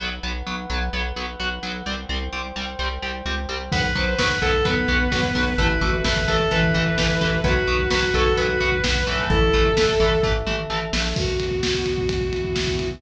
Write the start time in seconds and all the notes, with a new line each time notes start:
0.00 B1 F#3 B3 B4 F#5
0.23 B1 F#3 B3
0.47 B1 F#3 B3
0.70 B1 F#3 B3
0.93 B1 F#3 B3
1.16 B1 F#3 B3
1.40 B1 F#3 B3
1.63 B1 F#3 B3
1.86 C2 G3 C4 C5 G5
2.09 C2 G3 C4
2.33 C2 G3 C4
2.56 C2 G3 C4
2.79 C2 G3 C4
3.02 C2 G3 C4
3.25 C#2 G3 C4
3.49 C2 G3 C4
3.71 B1 F#3 B3 B4 F#5, kick, crash
3.84 kick
3.95 B1 F#3 B3 C5, kick, closed hi-hat
4.19 B1 F#3 B3 B4, kick, snare
4.30 kick
4.42 B1 F#3 B3 A4, kick, closed hi-hat
4.53 kick
4.65 B1 F#3 B3 B4, kick, closed hi-hat
4.77 kick
4.88 B1 F#3 B3, kick, closed hi-hat
5.00 kick
5.12 B1 F#3 B3, kick, snare
5.23 kick
5.35 B1 F#3 B3, kick, open hi-hat
5.47 kick
5.58 A1 E3 A3 E4 A4 B4 E5, kick, closed hi-hat
5.70 kick
5.81 A1 E3 A3 F#4, kick, closed hi-hat
5.93 kick
6.04 A1 E3 A3 B4, kick, snare
6.16 kick
6.28 A1 E3 A3 A4, kick, closed hi-hat
6.40 kick
6.50 A1 E3 A3 B4, kick, closed hi-hat
6.63 kick
6.74 A1 E3 A3, kick, closed hi-hat
6.86 kick
6.98 A1 E3 A3, kick, snare
7.09 kick
7.21 A1 E3 A3, kick, closed hi-hat
7.32 kick
7.44 B1 F#3 B3 F#4 B4 F#5, kick, closed hi-hat
7.56 kick
7.67 B1 F#3 B3, kick, closed hi-hat
7.79 kick
7.91 B1 F#3 B3 B4, kick, snare
8.03 kick
8.14 B1 F#3 B3 A4, kick, closed hi-hat
8.26 kick
8.37 B1 F#3 B3 B4, kick, closed hi-hat
8.49 kick
8.60 B1 F#3 B3, kick, closed hi-hat
8.72 kick
8.84 B1 F#3 B3, kick, snare
8.95 kick
9.07 B1 E3 A3, kick, closed hi-hat
9.19 kick
9.29 A1 E4 A4 E5, kick, closed hi-hat
9.42 kick
9.53 A1 E3 A3, kick, closed hi-hat
9.65 kick
9.77 A1 E3 A3, kick, snare
9.89 kick
10.00 A1 E3 A3, kick, closed hi-hat
10.11 kick
10.23 A1 E3 A3, kick, floor tom
10.46 A1 E3 A3, mid tom
10.70 A1 E3 A3
10.93 A#1 E3 A3, snare
11.16 B2 B3 F#4, kick, crash
11.28 kick
11.40 kick, ride
11.51 kick
11.63 kick, snare
11.74 kick
11.86 kick, ride
11.98 kick
12.09 E3 B3 E4, kick, ride
12.21 kick
12.33 kick, ride
12.44 kick
12.56 kick, snare
12.67 kick
12.79 kick, ride
12.91 kick